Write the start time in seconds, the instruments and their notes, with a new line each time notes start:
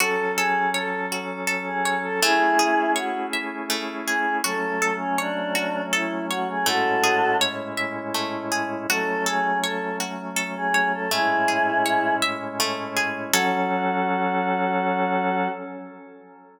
0.00 drawbar organ F#3 C#4 A4, pizzicato strings F#4, choir aahs A4
0.36 choir aahs G#4, pizzicato strings A4
0.74 choir aahs A4, pizzicato strings C#5
1.12 pizzicato strings F#4
1.47 pizzicato strings A4
1.67 choir aahs G#4
1.85 pizzicato strings C#5
2.04 choir aahs A4
2.22 drawbar organ A3 C#4 E4 G#4, pizzicato strings A3, choir aahs E4 G#4
2.59 pizzicato strings G#4
2.96 choir aahs F#4, pizzicato strings C#5
3.33 pizzicato strings E5
3.70 pizzicato strings A3
4.07 choir aahs G#4, pizzicato strings G#4
4.44 drawbar organ F#3 A3 C#4, pizzicato strings F#4, choir aahs A4
4.82 pizzicato strings A4
4.99 choir aahs C#4
5.18 choir aahs D4, pizzicato strings C#5
5.55 pizzicato strings F#4
5.93 choir aahs E4, pizzicato strings A4
6.30 choir aahs F#4, pizzicato strings C#5
6.48 choir aahs G#4
6.66 drawbar organ A2 G#3 C#4 E4, pizzicato strings A3, choir aahs F#4 A4
7.04 pizzicato strings G#4
7.41 pizzicato strings C#5
7.77 pizzicato strings E5
8.14 pizzicato strings A3
8.52 pizzicato strings G#4
8.89 drawbar organ F#3 A3 C#4, pizzicato strings F#4, choir aahs A4
9.26 choir aahs G#4, pizzicato strings A4
9.63 choir aahs A4, pizzicato strings C#5
10.00 pizzicato strings F#4
10.36 pizzicato strings A4
10.56 choir aahs G#4
10.74 pizzicato strings C#5
10.93 choir aahs A4
11.11 drawbar organ A2 G#3 C#4 E4, pizzicato strings A3, choir aahs E4 G#4
11.48 pizzicato strings G#4
11.86 pizzicato strings C#5
12.22 pizzicato strings E5
12.60 pizzicato strings A3
12.97 pizzicato strings G#4
13.33 drawbar organ F#3 C#4 A4, pizzicato strings F#4 A4 C#5, choir aahs F#4